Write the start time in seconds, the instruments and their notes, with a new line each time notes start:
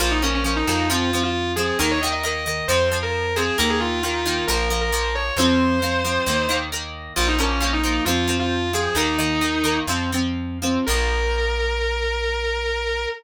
0.00 electric bass (finger) A#1, acoustic guitar (steel) F3 A#3, distortion guitar F4
0.11 distortion guitar D#4
0.22 acoustic guitar (steel) F3 A#3, distortion guitar C#4
0.34 distortion guitar C#4
0.44 acoustic guitar (steel) F3 A#3, distortion guitar C#4
0.56 distortion guitar D#4
0.67 electric bass (finger) F2, acoustic guitar (steel) F3 A#3
0.90 acoustic guitar (steel) F3 C4, distortion guitar F4
1.13 acoustic guitar (steel) F3 C4
1.23 distortion guitar F4
1.56 acoustic guitar (steel) F3 C4, distortion guitar G#4
1.79 electric bass (finger) D#2, acoustic guitar (steel) D#3 A#3, distortion guitar A#4
1.91 distortion guitar C#5
2.01 acoustic guitar (steel) D#3 A#3, distortion guitar D#5
2.13 distortion guitar D#5
2.23 acoustic guitar (steel) D#3 A#3, distortion guitar D#5
2.35 distortion guitar D#5
2.46 acoustic guitar (steel) D#3 A#3
2.68 electric bass (finger) F2, acoustic guitar (steel) F3 C4, distortion guitar C5
2.92 acoustic guitar (steel) F3 C4
3.03 distortion guitar A#4
3.36 acoustic guitar (steel) F3 C4, distortion guitar G#4
3.58 electric bass (finger) D#2, acoustic guitar (steel) D#3 A#3, distortion guitar A#4
3.70 distortion guitar G#4
3.80 distortion guitar F4
3.91 distortion guitar F4
4.03 acoustic guitar (steel) D#3 A#3, distortion guitar F4
4.14 distortion guitar F4
4.26 acoustic guitar (steel) D#3 A#3
4.47 electric bass (finger) A#1, acoustic guitar (steel) F3 A#3, distortion guitar A#4
4.70 acoustic guitar (steel) F3 A#3
4.81 distortion guitar A#4
4.92 acoustic guitar (steel) F3 A#3
5.15 distortion guitar C#5
5.37 electric bass (finger) F2, acoustic guitar (steel) F3 C4, distortion guitar C5
5.82 acoustic guitar (steel) F3 C4
6.04 acoustic guitar (steel) F3 C4
6.26 electric bass (finger) D#2, acoustic guitar (steel) D#3 A#3
6.49 acoustic guitar (steel) D#3 A#3
6.72 acoustic guitar (steel) D#3 A#3
7.16 electric bass (finger) A#1, acoustic guitar (steel) F3 A#3, distortion guitar F4
7.28 distortion guitar D#4
7.38 acoustic guitar (steel) F3 A#3, distortion guitar C#4
7.50 distortion guitar C#4
7.60 acoustic guitar (steel) F3 A#3, distortion guitar C#4
7.73 distortion guitar D#4
7.83 acoustic guitar (steel) F3 A#3
8.05 electric bass (finger) F2, acoustic guitar (steel) F3 C4, distortion guitar F4
8.28 acoustic guitar (steel) F3 C4
8.39 distortion guitar F4
8.73 acoustic guitar (steel) F3 C4, distortion guitar G#4
8.95 electric bass (finger) D#2, acoustic guitar (steel) D#3 A#3, distortion guitar D#4
9.18 acoustic guitar (steel) D#3 A#3
9.41 acoustic guitar (steel) D#3 A#3
9.64 acoustic guitar (steel) D#3 A#3
9.87 electric bass (finger) F2, acoustic guitar (steel) F3 C4
10.12 acoustic guitar (steel) F3 C4
10.62 acoustic guitar (steel) F3 C4
10.87 electric bass (finger) A#1, acoustic guitar (steel) F3 A#3, distortion guitar A#4